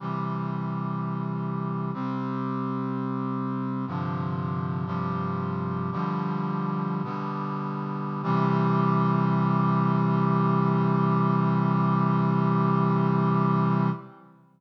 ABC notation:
X:1
M:4/4
L:1/8
Q:1/4=62
K:C
V:1 name="Brass Section"
[C,E,G,]4 [C,G,C]4 | "^rit." [G,,C,D,F,]2 [G,,C,F,G,]2 [B,,D,F,G,]2 [B,,D,G,B,]2 | [C,E,G,]8 |]